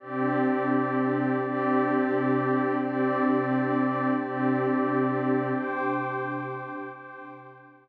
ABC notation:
X:1
M:6/8
L:1/8
Q:3/8=87
K:Cmix
V:1 name="Pad 2 (warm)"
[C,DG]6 | [C,DG]6 | [C,DG]6 | [C,DG]6 |
[C,DG]6 | [C,DG]6 |]
V:2 name="Pad 2 (warm)"
[CGd]6 | [CGd]6 | [CGd]6 | [CGd]6 |
[cgd']6 | [cgd']6 |]